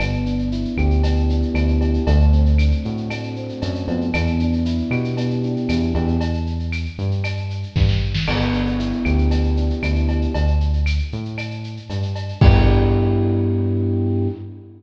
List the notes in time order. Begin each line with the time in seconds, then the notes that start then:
0.00 G1 B3, cowbell, claves, shaker
0.13 shaker
0.26 D4, shaker
0.39 shaker
0.52 E4, shaker
0.65 shaker
0.77 D2 G4, claves, shaker
0.91 shaker
1.03 B3, cowbell, shaker
1.16 shaker
1.29 D4, shaker
1.42 shaker
1.54 D2 E4, cowbell, claves, shaker
1.68 shaker
1.81 G4, cowbell, shaker
1.94 shaker
2.07 D2 A3, cowbell, shaker
2.20 shaker
2.32 C4, shaker
2.46 shaker
2.58 D4, claves, shaker
2.71 shaker
2.85 A2 F#4, shaker
2.97 shaker
3.10 A3, cowbell, claves, shaker
3.23 shaker
3.36 C4, shaker
3.49 shaker
3.62 F#2 D4, cowbell, shaker
3.75 shaker
3.88 F2 B3, cowbell, shaker
4.01 shaker
4.14 E2, cowbell, claves, shaker
4.27 shaker
4.39 D4, shaker
4.53 shaker
4.65 E4, shaker
4.78 shaker
4.91 B2 G4, claves, shaker
5.04 shaker
5.17 B3, cowbell, shaker
5.30 shaker
5.43 D4, shaker
5.56 shaker
5.69 E2 E4, cowbell, claves, shaker
5.82 shaker
5.95 E2 G4, cowbell, shaker
6.08 shaker
6.21 cowbell, shaker
6.34 shaker
6.46 shaker
6.60 shaker
6.72 claves, shaker
6.85 shaker
6.98 G2, shaker
7.11 shaker
7.24 cowbell, claves, shaker
7.37 shaker
7.50 shaker
7.63 shaker
7.76 G2, kick, snare
7.89 snare
8.14 snare
8.27 G1 B3, crash, cowbell, claves
8.41 shaker
8.53 D4, shaker
8.66 shaker
8.79 E4, shaker
8.92 shaker
9.05 D2 G4, claves, shaker
9.18 shaker
9.31 B3, cowbell, shaker
9.44 shaker
9.57 D4, shaker
9.70 shaker
9.82 D2 E4, cowbell, claves, shaker
9.96 shaker
10.09 G4, cowbell, shaker
10.22 shaker
10.34 D2, cowbell, shaker
10.47 shaker
10.60 shaker
10.73 shaker
10.86 claves, shaker
10.99 shaker
11.12 A2, shaker
11.25 shaker
11.38 cowbell, claves, shaker
11.51 shaker
11.64 shaker
11.77 shaker
11.90 G2, cowbell, shaker
12.02 shaker
12.16 cowbell, shaker
12.28 shaker
12.41 G2 B3 D4 E4 G4, kick, crash